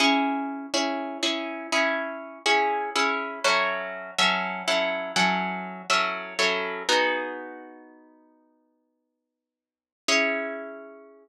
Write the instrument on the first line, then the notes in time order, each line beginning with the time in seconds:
acoustic guitar (steel)
0.00 C#4 E4 G#4
0.74 C#4 E4 G#4
1.23 C#4 E4 G#4
1.72 C#4 E4 G#4
2.46 C#4 E4 G#4
2.95 C#4 E4 G#4
3.44 F#3 C#4 E4 A4
4.18 F#3 C#4 E4 A4
4.68 F#3 C#4 E4 A4
5.16 F#3 C#4 E4 A4
5.90 F#3 C#4 E4 A4
6.39 F#3 C#4 E4 A4
6.89 B3 D#4 F#4 G#4
10.08 C#4 E4 G#4